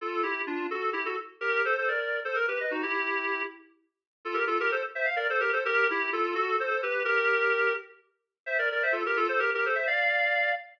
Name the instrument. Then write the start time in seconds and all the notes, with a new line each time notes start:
clarinet
0.01 F4 A4
0.23 E4 G4
0.47 D4 F4
0.70 F#4 A4
0.93 E4 G4
1.05 F#4 A4
1.41 G4 A#4
1.65 A4 C5
1.78 A4 C5
1.88 A#4 D5
2.25 A4 C5
2.35 A#4
2.48 G4 B4
2.60 B4 D#5
2.71 D#4 F#4
2.83 E4 G4
4.25 F4 A4
4.34 G4 A#4
4.47 F4 A4
4.60 G4 A#4
4.71 A4 C5
4.95 C5 E5
5.05 F5
5.16 A#4 D5
5.30 A4 C5
5.40 G4 A#4
5.53 A4 C5
5.65 G4 A#4
5.90 E4 G4
6.13 F4 A4
6.35 F#4 A4
6.60 A4 C5
6.70 A4 C5
6.83 G4 B4
7.05 G4 A#4
8.46 C5 E5
8.58 A#4 D5
8.72 A#4 D5
8.83 C5 E5
8.92 F4 A4
9.06 G4 A#4
9.16 F4 A4
9.29 A4 C5
9.39 G4 A#4
9.54 G4 A#4
9.65 A4 C5
9.75 C5 E5
9.87 D5 F5